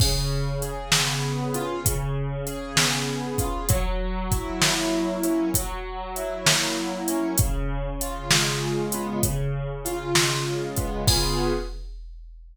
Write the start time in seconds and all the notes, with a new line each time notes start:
0.00 C#3, kick, crash
0.62 G#4, closed hi-hat
0.92 B3, snare
1.54 F4, closed hi-hat
1.85 C#3, kick, closed hi-hat
2.47 G#4, closed hi-hat
2.76 B3, snare
3.38 F4, kick, closed hi-hat
3.69 F#3, kick, closed hi-hat
4.31 E4, kick, closed hi-hat
4.61 A#3, snare
5.23 C#4, closed hi-hat
5.54 F#3, kick, closed hi-hat
6.16 E4, closed hi-hat
6.46 A#3, snare
7.08 C#4, closed hi-hat
7.38 C#3, kick, closed hi-hat
8.01 F4, closed hi-hat
8.30 G#3, snare
8.92 B3, closed hi-hat
9.23 C#3, kick, closed hi-hat
9.85 F4, closed hi-hat
10.15 G#3, snare
10.77 B3, kick, closed hi-hat
11.08 C#3 B3 F4 G#4, kick, crash